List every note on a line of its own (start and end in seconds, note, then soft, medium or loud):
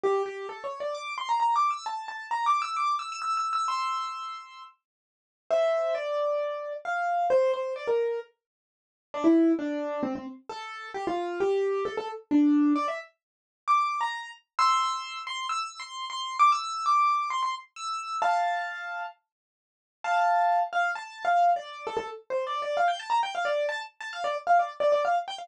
0.04 0.22 G4 loud
0.26 0.47 G4 medium
0.49 0.63 A4 medium
0.64 0.78 C#5 medium
0.80 0.95 D5 medium
0.95 1.13 D6 medium
1.18 1.28 C6 medium
1.29 1.39 A#5 medium
1.40 1.54 A#5 medium
1.56 1.70 D6 medium
1.70 1.85 E6 medium
1.86 2.05 A5 medium
2.08 2.29 A5 medium
2.31 2.45 A#5 medium
2.46 2.61 D6 medium
2.62 2.76 E6 medium
2.76 2.95 D6 medium
2.99 3.10 E6 medium
3.12 3.21 E6 medium
3.22 3.36 E6 medium
3.37 3.52 E6 medium
3.53 3.67 E6 medium
3.68 4.62 C6 medium
3.68 4.62 E6 medium
5.50 5.94 C5 medium
5.50 5.94 E5 medium
5.95 6.73 D5 medium
6.85 7.27 F5 medium
7.30 7.52 C5 loud
7.54 7.74 C5 medium
7.76 7.87 D5 medium
7.87 8.20 A#4 medium
9.14 9.25 D4 loud
9.24 9.52 E4 loud
9.59 10.01 D4 loud
10.03 10.14 C4 loud
10.15 10.26 C4 medium
10.49 10.89 A4 loud
10.94 11.05 G4 loud
11.07 11.40 F4 loud
11.40 11.84 G4 loud
11.85 11.96 A4 medium
11.97 12.08 A4 loud
12.31 12.73 D4 loud
12.76 12.86 D5 loud
12.88 12.99 E5 medium
13.68 14.00 D6 medium
14.01 14.29 A#5 medium
14.59 15.19 C6 loud
14.59 15.19 E6 loud
15.27 15.46 C6 loud
15.49 15.79 E6 loud
15.80 16.05 C6 medium
16.10 16.36 C6 loud
16.39 16.50 D6 loud
16.52 16.86 E6 loud
16.86 17.29 D6 medium
17.30 17.41 C6 medium
17.43 17.53 C6 medium
17.76 18.18 E6 medium
18.22 19.03 F5 medium
18.22 19.03 A5 loud
20.04 20.60 F5 medium
20.04 20.60 A5 medium
20.73 20.91 F5 loud
20.95 21.23 A5 medium
21.25 21.50 F5 medium
21.56 21.86 D5 medium
21.87 21.96 A4 loud
21.97 22.07 A4 loud
22.30 22.45 C5 medium
22.47 22.61 D5 medium
22.62 22.77 D5 medium
22.77 22.88 F5 medium
22.88 22.99 G5 medium
23.00 23.10 A5 loud
23.10 23.21 A#5 medium
23.23 23.34 G5 medium
23.35 23.45 F5 medium
23.45 23.66 D5 medium
23.69 23.79 A5 loud
24.00 24.11 A5 medium
24.13 24.24 F5 loud
24.24 24.35 D5 loud
24.47 24.58 F5 medium
24.59 24.70 D5 medium
24.80 24.91 D5 medium
24.92 25.03 D5 medium
25.05 25.15 F5 medium
25.28 25.38 G5 loud
25.38 25.48 F5 medium